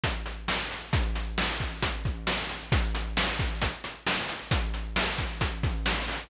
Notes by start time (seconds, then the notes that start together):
0.04 kick, closed hi-hat
0.26 closed hi-hat
0.48 snare
0.71 closed hi-hat
0.93 kick, closed hi-hat
1.15 closed hi-hat
1.38 snare
1.60 kick, closed hi-hat
1.83 kick, closed hi-hat
2.05 kick, closed hi-hat
2.27 snare
2.49 closed hi-hat
2.72 kick, closed hi-hat
2.95 closed hi-hat
3.17 snare
3.39 kick, closed hi-hat
3.62 kick, closed hi-hat
3.84 closed hi-hat
4.07 snare
4.29 closed hi-hat
4.51 kick, closed hi-hat
4.74 closed hi-hat
4.96 snare
5.18 kick, closed hi-hat
5.41 kick, closed hi-hat
5.63 kick, closed hi-hat
5.86 snare
6.08 open hi-hat